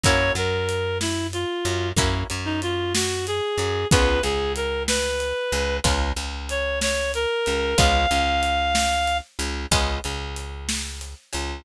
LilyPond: <<
  \new Staff \with { instrumentName = "Clarinet" } { \time 12/8 \key des \major \tempo 4. = 62 des''8 bes'4 fes'8 f'4 r8. ees'16 f'8 ges'8 aes'4 | ces''8 aes'8 bes'8 ces''4. r4 des''8 des''8 bes'4 | f''2~ f''8 r2. r8 | }
  \new Staff \with { instrumentName = "Acoustic Guitar (steel)" } { \time 12/8 \key des \major <bes des' fes' ges'>8 ges2 ges8 <bes des' fes' ges'>8 ges2 ges8 | <aes ces' des' f'>8 des2 des8 <aes ces' des' f'>8 des2 des8 | <aes ces' des' f'>8 des2 des8 <aes ces' des' f'>8 des2 des8 | }
  \new Staff \with { instrumentName = "Electric Bass (finger)" } { \clef bass \time 12/8 \key des \major ges,8 ges,2 ges,8 ges,8 ges,2 ges,8 | des,8 des,2 des,8 des,8 des,2 des,8 | des,8 des,2 des,8 des,8 des,2 des,8 | }
  \new DrumStaff \with { instrumentName = "Drums" } \drummode { \time 12/8 <hh bd>8 hh8 hh8 sn8 hh8 hh8 <hh bd>8 hh8 hh8 sn8 hh8 hh8 | <hh bd>8 hh8 hh8 sn8 hh8 hh8 <hh bd>8 hh8 hh8 sn8 hh8 hh8 | <hh bd>8 hh8 hh8 sn8 hh8 hh8 <hh bd>8 hh8 hh8 sn8 hh8 hh8 | }
>>